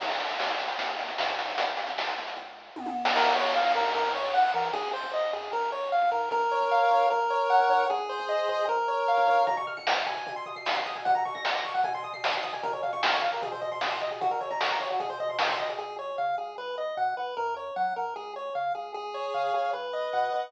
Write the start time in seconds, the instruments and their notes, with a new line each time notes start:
0.00 synth bass 1 A#1, kick, crash
0.09 closed hi-hat
0.19 closed hi-hat
0.29 closed hi-hat
0.40 synth bass 1 D#2, snare
0.49 closed hi-hat
0.59 closed hi-hat
0.68 closed hi-hat
0.78 synth bass 1 D#2, kick, closed hi-hat
0.89 closed hi-hat
0.99 closed hi-hat
1.08 closed hi-hat
1.18 synth bass 1 G#2, snare
1.28 kick, closed hi-hat
1.39 closed hi-hat
1.48 open hi-hat
1.57 synth bass 1 G#1, kick, closed hi-hat
1.68 closed hi-hat
1.77 closed hi-hat
1.87 kick, closed hi-hat
1.97 synth bass 1 C#2, snare
2.07 closed hi-hat
2.17 synth bass 1 C#2, closed hi-hat
2.27 closed hi-hat
2.37 kick
2.76 synth bass 1 F#2, high tom
2.86 high tom
3.05 snare
3.15 synth bass 1 A#1, lead 1 (square) A#4, kick, crash
3.35 lead 1 (square) C#5
3.55 lead 1 (square) F5
3.75 synth bass 1 G#2, lead 1 (square) A#4
3.95 synth bass 1 F#2, lead 1 (square) A#4, kick
4.14 lead 1 (square) C#5
4.34 lead 1 (square) F#5
4.44 kick
4.54 synth bass 1 E3, lead 1 (square) A#4
4.73 synth bass 1 G#1, lead 1 (square) G#4, kick
4.93 lead 1 (square) C5
5.03 kick
5.13 lead 1 (square) D#5
5.33 synth bass 1 F#2, lead 1 (square) G#4
5.52 synth bass 1 A#1, lead 1 (square) A#4, kick
5.72 lead 1 (square) C#5
5.92 lead 1 (square) F5
6.02 kick
6.12 synth bass 1 G#2, lead 1 (square) A#4
6.31 synth bass 1 A#1, lead 1 (square) A#4, kick
6.51 lead 1 (square) C#5
6.61 kick
6.71 lead 1 (square) F5
6.91 synth bass 1 G#2, lead 1 (square) C#5
7.10 synth bass 1 A#1, lead 1 (square) A#4, kick
7.30 lead 1 (square) C#5
7.50 lead 1 (square) F#5
7.59 kick
7.69 synth bass 1 G#2, lead 1 (square) C#5
7.90 synth bass 1 C2, lead 1 (square) G#4, kick
8.09 lead 1 (square) C5
8.19 kick
8.29 lead 1 (square) D#5
8.48 synth bass 1 A#2, lead 1 (square) C5
8.68 synth bass 1 A#1, lead 1 (square) A#4, kick
8.88 lead 1 (square) C#5
9.08 lead 1 (square) F5
9.18 kick
9.28 synth bass 1 G#2, lead 1 (square) C#5, kick
9.47 lead 1 (square) A#5, kick, floor tom
9.57 lead 1 (square) C#6, floor tom
9.67 lead 1 (square) F6, floor tom
9.77 lead 1 (square) C#7, kick, floor tom
9.87 lead 1 (square) F7, snare
9.97 lead 1 (square) C#7, floor tom
10.06 lead 1 (square) G#5, floor tom
10.16 floor tom
10.26 kick, floor tom
10.36 lead 1 (square) C6, floor tom
10.46 lead 1 (square) D#6, floor tom
10.56 lead 1 (square) C7, floor tom
10.66 lead 1 (square) D#7, snare
10.75 lead 1 (square) C7, kick, floor tom
10.86 lead 1 (square) D#6, floor tom
10.95 lead 1 (square) G#5, floor tom
11.05 lead 1 (square) F#5, kick, floor tom
11.15 lead 1 (square) A#5, floor tom
11.25 lead 1 (square) C#6, floor tom
11.34 lead 1 (square) A#6, kick, floor tom
11.45 lead 1 (square) C#7, snare
11.55 lead 1 (square) A#6, floor tom
11.65 lead 1 (square) C#6, floor tom
11.74 lead 1 (square) F#5, floor tom
11.84 lead 1 (square) G#5, kick, floor tom
11.94 lead 1 (square) C6, floor tom
12.03 lead 1 (square) D#6, floor tom
12.13 lead 1 (square) C7, floor tom
12.24 lead 1 (square) D#7, snare
12.33 lead 1 (square) C7, floor tom
12.43 lead 1 (square) D#6, kick, floor tom
12.53 lead 1 (square) G#5, floor tom
12.63 lead 1 (square) A#4, kick, floor tom
12.72 lead 1 (square) C#5, floor tom
12.83 lead 1 (square) F5, floor tom
12.93 lead 1 (square) C#6, kick, floor tom
13.03 lead 1 (square) F6, snare
13.13 lead 1 (square) C#6, floor tom
13.22 lead 1 (square) F5, floor tom
13.32 lead 1 (square) A#4, floor tom
13.42 lead 1 (square) G#4, kick, floor tom
13.52 lead 1 (square) C5, floor tom
13.61 lead 1 (square) D#5, floor tom
13.72 lead 1 (square) C6, floor tom
13.81 lead 1 (square) D#6, snare
13.91 lead 1 (square) C6, floor tom
14.01 lead 1 (square) D#5, floor tom
14.11 lead 1 (square) G#4, floor tom
14.21 lead 1 (square) F#4, kick, floor tom
14.30 lead 1 (square) A#4, floor tom
14.41 lead 1 (square) C#5, floor tom
14.51 lead 1 (square) A#5, kick, floor tom
14.61 lead 1 (square) C#6, snare
14.70 lead 1 (square) A#5, floor tom
14.80 lead 1 (square) C#5, floor tom
14.90 lead 1 (square) F#4, floor tom
15.00 lead 1 (square) G#4, kick, floor tom
15.10 lead 1 (square) C5, floor tom
15.20 lead 1 (square) D#5, floor tom
15.29 lead 1 (square) C6, floor tom
15.39 lead 1 (square) D#6, snare
15.49 lead 1 (square) C6, kick, floor tom
15.59 lead 1 (square) D#5, floor tom
15.69 lead 1 (square) G#4, floor tom
15.79 synth bass 1 C#2, lead 1 (square) G#4
15.99 lead 1 (square) C#5
16.18 synth bass 1 C#3, lead 1 (square) F5
16.38 synth bass 1 C#2, lead 1 (square) G#4
16.58 synth bass 1 B1, lead 1 (square) B4
16.78 lead 1 (square) D#5
16.97 synth bass 1 B2, lead 1 (square) F#5
17.17 synth bass 1 B1, lead 1 (square) B4
17.37 synth bass 1 F#2, lead 1 (square) A#4
17.56 lead 1 (square) C#5
17.76 synth bass 1 F#3, lead 1 (square) F#5
17.96 synth bass 1 F#2, lead 1 (square) A#4
18.16 synth bass 1 C#2, lead 1 (square) G#4
18.36 lead 1 (square) C#5
18.55 synth bass 1 C#3, lead 1 (square) F5
18.75 synth bass 1 C#2, lead 1 (square) G#4
18.94 synth bass 1 C#2, lead 1 (square) G#4
19.14 lead 1 (square) C#5
19.34 synth bass 1 C#3, lead 1 (square) F5
19.54 synth bass 1 C#2, lead 1 (square) G#4
19.73 synth bass 1 B1, lead 1 (square) B4
19.93 lead 1 (square) D#5
20.13 synth bass 1 B2, lead 1 (square) F#5
20.32 synth bass 1 B1, lead 1 (square) B4